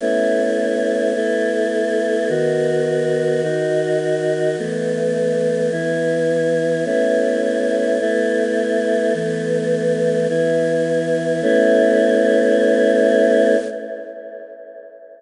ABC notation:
X:1
M:4/4
L:1/8
Q:1/4=105
K:Alyd
V:1 name="Choir Aahs"
[A,B,CE]4 [A,B,EA]4 | [D,B,F]4 [D,DF]4 | [E,A,B,]4 [E,B,E]4 | [A,B,CE]4 [A,B,EA]4 |
[E,A,B,]4 [E,B,E]4 | [A,B,CE]8 |]